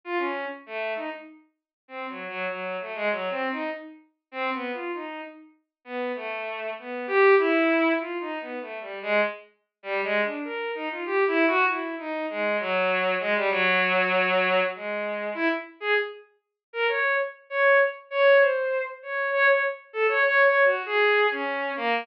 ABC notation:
X:1
M:4/4
L:1/16
Q:1/4=98
K:none
V:1 name="Violin"
F ^C2 z A,2 ^D z5 (3=C2 ^F,2 F,2 | ^F,2 A, ^G, (3F,2 C2 ^D2 z4 (3C2 B,2 =F2 | ^D2 z4 B,2 A,4 B,2 G2 | E4 (3F2 ^D2 B,2 (3A,2 G,2 ^G,2 z4 |
(3G,2 ^G,2 D2 ^A2 ^D F (3=G2 E2 ^F2 E2 D2 | ^G,2 ^F,4 G, =G, F,8 | ^G,4 E z2 ^G z5 ^A ^c2 | z2 ^c2 z2 c2 =c3 z ^c2 c c |
z2 A ^c (3c2 c2 ^F2 ^G3 ^C3 ^A,2 |]